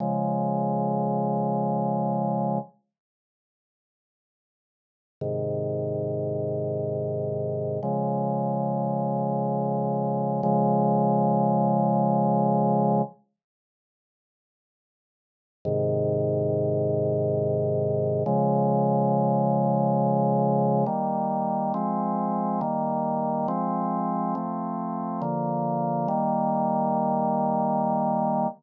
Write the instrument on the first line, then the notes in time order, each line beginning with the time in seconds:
drawbar organ
0.00 C#3 F3 G#3
5.21 G#2 C3 D#3
7.83 C#3 F3 G#3
10.43 C#3 F3 G#3
15.65 G#2 C3 D#3
18.26 C#3 F3 G#3
20.86 D#3 G3 A#3
21.74 F3 G#3 C4
22.61 D#3 G3 A#3
23.48 F3 G#3 C4
24.35 F3 A3 C4
25.22 D3 F3 A#3
26.08 D#3 G3 A#3